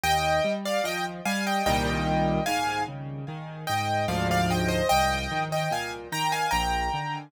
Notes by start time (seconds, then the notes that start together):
0.04 D#2 D#5 G5
0.44 G3
0.66 D5 F5
0.84 F3 D#5 G5
1.26 G3 F5 G#5
1.47 D#5 G5
1.66 C2 A#2 D#3 G3 D#5 G5
2.46 G#2 F5 G#5
2.88 C#3
3.28 D#3
3.67 G#2 D#5 G5
4.08 D2 G#2 F3 D5 F5
4.31 D5 F5
4.51 D#5 G5
4.68 C5 D#5
4.89 C2 D#5 G5
5.31 D#3
5.52 D#5 G5
5.71 A#2 F5 G#5
6.12 D#3 G5 A#5
6.32 F5 G#5
6.51 A#1 G5 A#5
6.94 D3